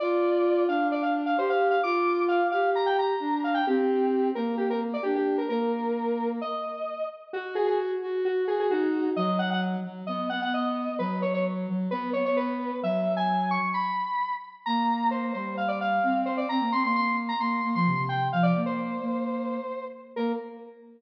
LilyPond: <<
  \new Staff \with { instrumentName = "Lead 1 (square)" } { \time 4/4 \key bes \major \tempo 4 = 131 d''4. f''8 d''16 f''16 r16 f''16 c''16 f''8 f''16 | d'''4 f''8 f''8 bes''16 g''16 bes''4 f''16 g''16 | g'4. bes'8 g'16 bes'16 r16 d''16 g'16 g'8 bes'16 | bes'2 ees''4. r8 |
\key b \major fis'8 gis'16 gis'16 r4 fis'8 gis'16 gis'16 fis'4 | dis''8 fis''16 fis''16 r4 dis''8 fis''16 fis''16 dis''4 | b'8 cis''16 cis''16 r4 b'8 cis''16 cis''16 b'4 | e''8. gis''8. cis'''8 b''4. r8 |
\key bes \major bes''4 c''8 c''8 f''16 d''16 f''4 c''16 d''16 | bes''8 c'''16 c'''16 c'''8 r16 bes''16 c'''8. c'''8. g''8 | f''16 d''8 c''2~ c''8. r8 | bes'4 r2. | }
  \new Staff \with { instrumentName = "Ocarina" } { \time 4/4 \key bes \major f'4. d'4. g'4 | f'4. g'4. d'4 | c'4. bes4. d'4 | bes2 r2 |
\key b \major fis'4. fis'4. dis'4 | fis4. fis8 b8 b4. | fis4. fis8 b8 b4. | fis2 r2 |
\key bes \major bes4. g4. c'4 | c'16 bes16 c'16 bes4~ bes16 bes8 bes16 f16 c16 c8. | f8 bes4 bes4. r4 | bes4 r2. | }
>>